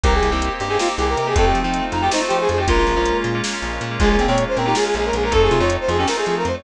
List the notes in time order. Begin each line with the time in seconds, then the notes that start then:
0.03 C2 A#3 C4 D#4 G4 A#4, kick, closed hi-hat
0.14 G#4
0.23 C2, closed hi-hat
0.31 C2 A#3 C4 D#4 G4
0.42 closed hi-hat
0.60 G2 G4, closed hi-hat
0.69 A#3 C4 D#4 G4 G#4
0.79 A#3 C4 D#4 F4 G4, snare
0.88 A#3 C4 D#4 G4
0.98 C2 G4 G#4, closed hi-hat
1.09 A#4
1.17 C3 A#4, closed hi-hat
1.27 A#3 C4 D#4 G4 G#4
1.35 F2 A3 C4 D#4 F4 A4, kick, closed hi-hat
1.45 G4
1.55 F3, closed hi-hat
1.64 F3 A3 C4 D#4 F4
1.74 closed hi-hat
1.92 F2 D#4, closed hi-hat
2.01 A3 C4 D#4 F4 G4
2.11 A3 C4 D#4 F4 C5, snare
2.21 A3 C4 D#4 F4
2.28 F3 G4, closed hi-hat
2.40 G#4
2.49 F2 G#4, closed hi-hat
2.58 A3 C4 D#4 F4 G4
2.68 A#1 G#3 A#3 C#4 F4 A#4, kick, closed hi-hat
2.78 F4
2.87 A#1, closed hi-hat
2.96 A#1 G#3 A#3 C#4 F4
3.06 closed hi-hat
3.24 A#2, closed hi-hat
3.35 G#3 A#3 C#4 F4
3.44 G#3 A#3 C#4 F4, snare
3.53 G#3 A#3 C#4 F4
3.62 A#1, closed hi-hat
3.81 A#2, closed hi-hat
3.91 G#3 A#3 C#4 F4
3.99 A#1 G#3 A#3 C#4 F4 G#4, kick, closed hi-hat
4.10 G#4
4.19 A#1 C4, closed hi-hat
4.28 A#2 G#3 A#3 C4 C#4 F4 C#5
4.38 closed hi-hat
4.48 C5
4.57 A#2 C4 A#4, closed hi-hat
4.66 G#3 A#3 C#4 D#4 F4 G4
4.75 G#3 A#3 C#4 F4 G#4, snare
4.84 G#3 A#3 C#4 F4 G#4
4.94 A#1 G#4, closed hi-hat
5.05 A#4
5.13 A#1 G#4, closed hi-hat
5.23 G#3 A#3 C#4 F4 A#4
5.31 F2 A3 C4 D#4 F4 A4, kick, closed hi-hat
5.42 G#4
5.50 C3 F4, closed hi-hat
5.60 F2 A3 C4 D#4 F4 C#5
5.70 closed hi-hat
5.80 C5
5.88 F2 F4 G#4, closed hi-hat
5.98 A3 C4 C#4 D#4 F4 G4
6.07 A3 C4 D#4 F4 A#4, snare
6.17 A3 C4 D#4 F4 G#4
6.26 F3 G#4, closed hi-hat
6.38 A#4
6.45 F2 C5, closed hi-hat
6.54 A3 C4 D#4 F4 C#5